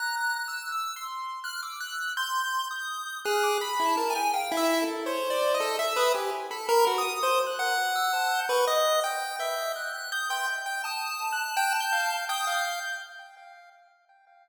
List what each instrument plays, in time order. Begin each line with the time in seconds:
0.00 acoustic grand piano A#5, lead 1 (square) F#6
0.18 lead 1 (square) F#6
0.36 lead 1 (square) F#6
0.48 acoustic grand piano E6
0.72 lead 1 (square) E6
0.96 acoustic grand piano C6
1.44 lead 1 (square) F6, acoustic grand piano F#6
1.63 acoustic grand piano D6, lead 1 (square) E6
1.80 acoustic grand piano F#6
2.17 lead 1 (square) C6, acoustic grand piano G6
2.71 lead 1 (square) D#6
3.25 lead 1 (square) G#4 F#6, acoustic grand piano F6
3.43 acoustic grand piano D6
3.61 lead 1 (square) B5, acoustic grand piano B5
3.80 lead 1 (square) E4
3.86 lead 1 (square) A5
3.97 lead 1 (square) A#4, acoustic grand piano A5
4.10 lead 1 (square) G#5
4.16 acoustic grand piano G5
4.34 acoustic grand piano F5, lead 1 (square) G5
4.52 lead 1 (square) E4
4.57 acoustic grand piano E5
4.82 acoustic grand piano A4
5.06 lead 1 (square) C5, acoustic grand piano C#5
5.30 acoustic grand piano D5
5.54 acoustic grand piano D#5
5.60 lead 1 (square) A4
5.79 acoustic grand piano E5
5.96 lead 1 (square) B4 D#6
6.14 lead 1 (square) G4, acoustic grand piano G#5
6.51 lead 1 (square) A4, acoustic grand piano B5
6.69 lead 1 (square) A#4
6.87 lead 1 (square) F#4
6.98 acoustic grand piano D#6
7.23 lead 1 (square) C5
7.47 acoustic grand piano F#6
7.59 lead 1 (square) F#5
7.95 lead 1 (square) E6
8.13 lead 1 (square) A5
8.31 acoustic grand piano G6
8.49 lead 1 (square) B4 C#6
8.67 lead 1 (square) D#5
9.04 lead 1 (square) G5
9.39 lead 1 (square) E5, acoustic grand piano G6
9.76 lead 1 (square) F#6
9.94 lead 1 (square) F#6
10.12 lead 1 (square) D#6, acoustic grand piano G6
10.30 lead 1 (square) G5 C6
10.66 lead 1 (square) G5
10.84 lead 1 (square) A5, acoustic grand piano D#6
11.32 acoustic grand piano F#6
11.57 lead 1 (square) G5
11.80 acoustic grand piano G6
11.92 lead 1 (square) F5
12.29 lead 1 (square) G5 D#6, acoustic grand piano G6
12.47 lead 1 (square) F5